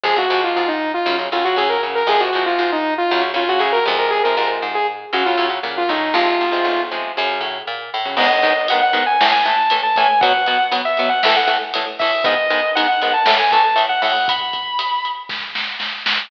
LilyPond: <<
  \new Staff \with { instrumentName = "Lead 2 (sawtooth)" } { \time 4/4 \key f \phrygian \tempo 4 = 118 aes'16 ges'8 f'16 f'16 ees'8 f'8 r16 f'16 ges'16 aes'16 bes'16 r16 bes'16 | aes'16 ges'8 f'16 f'16 ees'8 f'8 r16 f'16 ges'16 aes'16 bes'16 r16 bes'16 | aes'16 bes'16 bes'16 r8 aes'16 r8 ges'16 f'8 r8 f'16 ees'8 | f'4. r2 r8 |
\key gis \phrygian r1 | r1 | r1 | r1 | }
  \new Staff \with { instrumentName = "Distortion Guitar" } { \time 4/4 \key f \phrygian r1 | r1 | r1 | r1 |
\key gis \phrygian dis''4 fis''16 fis''8 gis''16 r16 gis''16 a''8 r16 a''16 gis''8 | fis''4 r16 e''8 fis''16 e''16 fis''16 r4 e''8 | dis''4 fis''16 fis''8 a''16 r16 gis''16 a''8 r16 fis''16 fis''8 | b''4. r2 r8 | }
  \new Staff \with { instrumentName = "Overdriven Guitar" } { \time 4/4 \key f \phrygian <c f aes>16 <c f aes>16 <c f aes>4. <des ges>16 <des ges>16 <des ges>16 <des ges>16 <des ges>8 <des ges>8 | <c f aes>16 <c f aes>16 <c f aes>4. <des ges>16 <des ges>16 <des ges>16 <des ges>16 <des ges>8 <c f aes>8~ | <c f aes>16 <c f aes>16 <c f aes>4. <des ges>16 <des ges>16 <des ges>16 <des ges>16 <des ges>8 <des ges>8 | <c f aes>8. <c f aes>8. <c f aes>8 <des ges>4.~ <des ges>16 <des ges>16 |
\key gis \phrygian <gis, dis b>8 <gis, dis b>8 <gis, dis b>8 <gis, dis b>8 <a, e a>8 <a, e a>8 <a, e a>8 <a, e a>8 | <b, fis b>8 <b, fis b>8 <b, fis b>8 <b, fis b>8 <a, e a>8 <a, e a>8 <a, e a>8 <a, e a>8 | <gis, dis b>8 <gis, dis b>8 <gis, dis b>8 <gis, dis b>8 <a, e a>8 <a, e a>8 <a, e a>8 <a, e a>8 | r1 | }
  \new Staff \with { instrumentName = "Electric Bass (finger)" } { \clef bass \time 4/4 \key f \phrygian f,8 aes,8 aes,4 ges,8 a,8 a,4 | f,8 aes,8 aes,4 ges,8 a,8 a,8 f,8~ | f,8 aes,8 aes,4 ges,8 a,8 bes,8 a,8 | aes,,8 b,,8 b,,4 ges,8 a,8 bes,8 a,8 |
\key gis \phrygian r1 | r1 | r1 | r1 | }
  \new DrumStaff \with { instrumentName = "Drums" } \drummode { \time 4/4 r4 r4 r4 r4 | r4 r4 r4 r4 | r4 r4 r4 r4 | r4 r4 r4 r4 |
<cymc bd>8 <hh bd>8 hh8 hh8 sn8 hh8 hh8 <hh bd>8 | <hh bd>8 hh8 hh8 hh8 sn8 hh8 hh8 <hho bd>8 | <hh bd>8 hh8 hh8 hh8 sn8 <hh bd>8 hh8 hho8 | <hh bd>8 <hh bd>8 hh8 hh8 <bd sn>8 sn8 sn8 sn8 | }
>>